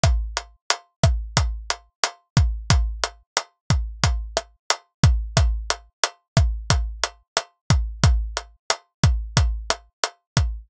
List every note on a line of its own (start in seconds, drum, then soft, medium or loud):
0.04 kick medium
0.04 cross-stick loud
0.04 closed hi-hat loud
0.37 closed hi-hat medium
0.70 closed hi-hat loud
1.04 kick medium
1.04 cross-stick medium
1.04 closed hi-hat medium
1.37 kick medium
1.37 closed hi-hat loud
1.70 closed hi-hat medium
2.04 cross-stick medium
2.04 closed hi-hat loud
2.37 kick medium
2.37 closed hi-hat medium
2.70 kick medium
2.70 closed hi-hat loud
3.04 closed hi-hat medium
3.37 cross-stick medium
3.37 closed hi-hat medium
3.70 kick medium
3.70 closed hi-hat medium
4.04 kick medium
4.04 closed hi-hat loud
4.37 cross-stick medium
4.37 closed hi-hat medium
4.70 closed hi-hat loud
5.04 kick medium
5.04 closed hi-hat medium
5.37 kick loud
5.37 cross-stick loud
5.37 closed hi-hat loud
5.70 closed hi-hat medium
6.04 closed hi-hat medium
6.37 kick medium
6.37 cross-stick medium
6.37 closed hi-hat medium
6.70 kick medium
6.70 closed hi-hat loud
7.04 closed hi-hat medium
7.37 cross-stick medium
7.37 closed hi-hat medium
7.70 kick medium
7.70 closed hi-hat medium
8.04 kick loud
8.04 closed hi-hat loud
8.37 closed hi-hat medium
8.70 cross-stick medium
8.70 closed hi-hat loud
9.04 kick medium
9.04 closed hi-hat medium
9.37 kick medium
9.37 closed hi-hat loud
9.70 cross-stick medium
9.70 closed hi-hat medium
10.04 closed hi-hat medium
10.37 kick medium
10.37 closed hi-hat medium